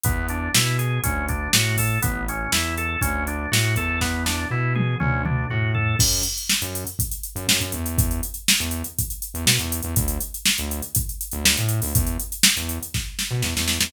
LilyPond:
<<
  \new Staff \with { instrumentName = "Drawbar Organ" } { \time 4/4 \key a \major \tempo 4 = 121 b8 d'8 e'8 gis'8 cis'8 d'8 fis'8 a'8 | b8 cis'8 e'8 a'8 cis'8 d'8 fis'8 a'8 | b8 d'8 e'8 gis'8 cis'8 d'8 fis'8 a'8 | \key fis \minor r1 |
r1 | r1 | r1 | }
  \new Staff \with { instrumentName = "Synth Bass 1" } { \clef bass \time 4/4 \key a \major e,4 b,4 d,4 a,4 | a,,4 e,4 d,4 a,8 e,8~ | e,4 b,4 d,4 a,4 | \key fis \minor fis,4~ fis,16 fis,4. fis,16 fis,16 fis,16 e,8~ |
e,4~ e,16 e,4. e,16 b,16 e,8 e,16 | d,4~ d,16 d,4. d,16 d,16 a,8 d,16 | e,4~ e,16 e,4. b,16 e,16 e,8 e,16 | }
  \new DrumStaff \with { instrumentName = "Drums" } \drummode { \time 4/4 <hh bd>8 hh8 sn8 hh8 <hh bd>8 <hh bd>8 sn8 <hho bd>8 | <hh bd>8 hh8 sn8 hh8 <hh bd>8 hh8 sn8 <hh bd>8 | <bd sn>8 sn8 r8 tommh8 toml8 toml8 tomfh8 tomfh8 | <cymc bd>16 hh16 hh16 hh16 sn16 hh16 hh16 hh16 <hh bd>16 hh16 hh16 hh16 sn16 hh16 hh16 hh16 |
<hh bd>16 hh16 hh16 hh16 sn16 hh16 hh16 hh16 <hh bd>16 hh16 hh16 hh16 sn16 hh16 hh16 hh16 | <hh bd>16 hh16 hh16 hh16 sn16 hh16 hh16 hh16 <hh bd>16 hh16 hh16 hh16 sn16 hh16 hh16 hho16 | <hh bd>16 hh16 hh16 hh16 sn16 hh16 hh16 hh16 <bd sn>8 sn8 sn16 sn16 sn16 sn16 | }
>>